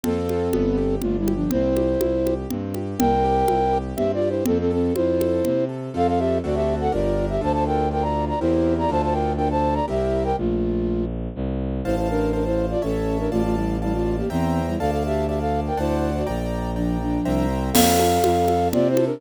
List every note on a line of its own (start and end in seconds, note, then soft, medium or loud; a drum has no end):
0.03 0.49 F2 medium
0.03 0.95 C4 medium
0.03 0.48 C4 loud
0.03 0.48 F4 medium
0.03 0.95 A4 loud
0.03 0.48 A4 medium
0.03 low conga medium
0.29 high conga medium
0.53 0.97 G1 medium
0.53 0.75 B3 loud
0.53 high conga medium
0.77 0.99 G4 medium
1.01 1.46 G1 medium
1.01 1.17 A3 medium
1.01 1.26 D4 medium
1.01 1.17 F4 loud
1.01 low conga medium
1.19 1.34 G3 medium
1.19 1.34 E4 loud
1.27 1.49 G4 medium
1.27 high conga medium
1.35 1.51 F3 medium
1.35 1.51 D4 loud
1.51 1.96 C2 medium
1.51 1.74 C4 loud
1.51 2.34 E4 medium
1.51 2.34 C5 loud
1.51 low conga medium
1.76 1.98 G4 medium
1.76 high conga medium
2.00 2.45 C2 medium
2.00 2.23 E4 medium
2.00 high conga medium
2.25 2.48 G4 medium
2.25 high conga medium
2.50 2.94 G2 medium
2.50 2.73 C4 medium
2.50 low conga medium
2.74 2.98 G4 medium
2.74 high conga medium
2.99 3.43 C2 loud
2.99 3.22 C4 loud
2.99 3.78 A#4 loud
2.99 3.78 G5 loud
2.99 low conga loud
3.24 3.46 G4 medium
3.48 3.93 C2 medium
3.48 3.72 E4 medium
3.48 high conga medium
3.73 3.95 G4 medium
3.96 4.42 G2 medium
3.96 4.19 C4 loud
3.96 4.12 G4 medium
3.96 4.12 E5 medium
3.96 low conga medium
4.14 4.29 F4 medium
4.14 4.29 D5 loud
4.21 4.43 G4 medium
4.29 4.44 E4 medium
4.29 4.44 C5 medium
4.46 4.91 F2 loud
4.46 4.58 C4 loud
4.46 4.68 C4 loud
4.46 4.58 A4 loud
4.46 low conga medium
4.60 4.72 C4 medium
4.60 4.72 A4 loud
4.70 4.94 C4 medium
4.70 4.93 A4 medium
4.70 4.94 A4 medium
4.95 5.40 F2 medium
4.95 5.65 E4 medium
4.95 5.18 F4 medium
4.95 5.65 C5 loud
4.95 high conga medium
5.20 5.42 A4 medium
5.20 high conga medium
5.45 5.89 C3 medium
5.45 5.67 C4 medium
5.45 low conga medium
5.69 5.91 A4 medium
5.94 6.39 F2 loud
5.94 6.38 C4 medium
5.94 6.38 F4 medium
5.94 6.38 A4 medium
5.94 6.07 A4 loud
5.94 6.07 F5 loud
6.08 6.19 A4 medium
6.08 6.19 F5 medium
6.19 6.38 G4 medium
6.19 6.38 E5 medium
6.43 6.88 D2 loud
6.43 6.88 C4 medium
6.43 6.88 D4 medium
6.43 6.56 F#4 medium
6.43 6.88 F#4 medium
6.43 6.88 A4 medium
6.43 6.56 D5 medium
6.55 6.75 G4 medium
6.55 6.75 E5 medium
6.81 6.92 A4 medium
6.81 6.92 F#5 medium
6.92 7.38 G1 loud
6.92 7.36 D4 medium
6.92 7.26 F4 medium
6.92 7.36 G4 medium
6.92 7.36 A#4 medium
6.92 7.26 D5 medium
7.29 7.41 G4 medium
7.29 7.41 E5 medium
7.41 8.32 D2 loud
7.41 7.85 D4 medium
7.41 7.85 F4 medium
7.41 7.85 A4 medium
7.41 7.52 C5 medium
7.41 7.52 A5 loud
7.53 7.64 C5 medium
7.53 7.64 A5 medium
7.66 7.89 A#4 medium
7.66 7.89 G5 medium
7.91 8.35 D4 medium
7.91 8.35 F4 medium
7.91 8.35 A4 medium
7.91 8.03 A#4 medium
7.91 8.03 G5 medium
8.02 8.25 D5 medium
8.02 8.25 A#5 medium
8.28 8.39 D5 medium
8.28 8.39 A#5 medium
8.40 8.85 E2 loud
8.40 8.85 C4 medium
8.40 8.74 E4 medium
8.40 8.85 E4 medium
8.40 8.85 G4 medium
8.40 8.85 A#4 medium
8.40 8.74 C5 medium
8.79 8.90 D5 medium
8.79 8.90 A#5 medium
8.89 9.80 D2 loud
8.89 9.33 D4 medium
8.89 9.33 F4 medium
8.89 9.33 A4 medium
8.89 9.02 C5 medium
8.89 9.02 A5 medium
9.02 9.14 C5 medium
9.02 9.14 A5 medium
9.12 9.33 A#4 medium
9.12 9.33 G5 medium
9.37 9.83 D4 medium
9.37 9.83 F4 medium
9.37 9.83 A4 medium
9.37 9.48 A#4 medium
9.37 9.48 G5 medium
9.51 9.74 C5 medium
9.51 9.74 A5 medium
9.74 9.86 D5 medium
9.74 9.86 A#5 medium
9.88 10.33 C2 loud
9.88 10.32 C4 medium
9.88 10.32 E4 medium
9.88 10.32 G4 medium
9.88 10.23 G4 medium
9.88 10.32 A#4 medium
9.88 10.23 E5 medium
10.25 10.36 A#4 medium
10.25 10.36 G5 medium
10.37 11.28 A#1 medium
10.37 11.05 A3 medium
10.37 11.05 F4 medium
11.35 11.81 C2 loud
11.84 12.75 A1 loud
11.84 11.96 E4 medium
11.84 11.96 C5 medium
11.84 12.29 C5 medium
11.84 12.29 F5 medium
11.84 12.29 A5 medium
11.97 12.09 E4 medium
11.97 12.09 C5 medium
12.10 12.32 D4 medium
12.10 12.32 A#4 medium
12.33 12.44 D4 medium
12.33 12.44 A#4 medium
12.33 12.77 C5 medium
12.33 12.77 F5 medium
12.33 12.77 A5 medium
12.45 12.66 E4 medium
12.45 12.66 C5 medium
12.71 12.82 F4 medium
12.71 12.82 D5 medium
12.82 13.28 A1 loud
12.82 13.18 C#4 medium
12.82 13.18 A4 medium
12.82 13.26 C#5 medium
12.82 13.26 E5 medium
12.82 13.26 A5 medium
13.19 13.31 D4 medium
13.19 13.31 A#4 medium
13.31 14.22 A1 loud
13.31 13.42 A3 medium
13.31 13.42 F4 loud
13.31 13.76 D5 medium
13.31 13.76 F5 medium
13.31 13.76 A5 medium
13.44 13.56 A3 medium
13.44 13.56 F4 medium
13.55 13.77 G3 medium
13.55 13.77 E4 medium
13.82 13.94 G3 medium
13.82 13.94 E4 medium
13.82 14.26 D5 medium
13.82 14.26 F5 medium
13.82 14.26 A5 medium
13.93 14.16 A3 medium
13.93 14.16 F4 loud
14.17 14.29 A#3 medium
14.17 14.29 G4 medium
14.30 14.75 E2 loud
14.30 14.61 E3 medium
14.30 14.61 C4 medium
14.30 14.74 C5 medium
14.30 14.74 E5 medium
14.30 14.74 G5 medium
14.30 14.74 A#5 medium
14.67 14.79 G3 medium
14.67 14.79 E4 medium
14.79 15.70 D2 loud
14.79 14.91 A4 medium
14.79 15.24 D5 medium
14.79 14.91 F5 loud
14.79 15.24 F5 medium
14.79 15.24 A5 medium
14.91 15.03 A4 medium
14.91 15.03 F5 medium
15.06 15.27 G4 medium
15.06 15.27 E5 medium
15.27 15.39 G4 medium
15.27 15.73 D5 medium
15.27 15.39 E5 medium
15.27 15.73 F5 medium
15.27 15.73 A5 medium
15.40 15.60 A4 medium
15.40 15.60 F5 medium
15.67 15.79 A#4 medium
15.67 15.79 G5 medium
15.77 16.22 D2 loud
15.77 16.11 E4 medium
15.77 16.22 C5 medium
15.77 16.11 C5 medium
15.77 16.22 D5 medium
15.77 16.22 F#5 medium
15.77 16.22 A5 medium
16.16 16.27 F#4 medium
16.16 16.27 D5 medium
16.27 17.18 A#1 loud
16.27 16.71 D5 medium
16.27 16.71 G5 medium
16.27 16.71 A#5 medium
16.76 16.98 F3 medium
16.76 16.98 D4 medium
16.76 17.20 D5 medium
16.76 17.20 G5 medium
16.76 17.20 A#5 medium
17.01 17.46 F3 medium
17.01 17.46 D4 medium
17.25 17.70 C2 loud
17.25 17.70 C5 medium
17.25 17.70 E5 medium
17.25 17.70 G5 medium
17.25 17.70 A#5 medium
17.73 18.18 F2 loud
17.73 17.97 C4 loud
17.73 18.68 A4 loud
17.73 18.68 F5 loud
17.73 crash loud
17.73 low conga loud
17.99 18.22 A4 medium
17.99 high conga medium
18.24 18.69 F2 loud
18.24 18.46 F4 medium
18.24 high conga medium
18.48 18.71 A4 medium
18.48 high conga medium
18.72 19.18 C3 loud
18.72 18.95 C4 loud
18.72 18.88 F4 loud
18.72 18.88 D5 loud
18.72 low conga medium
18.89 19.05 E4 medium
18.89 19.05 C5 loud
18.96 19.18 A4 medium
18.96 high conga medium
19.06 19.21 D4 loud
19.06 19.21 A#4 loud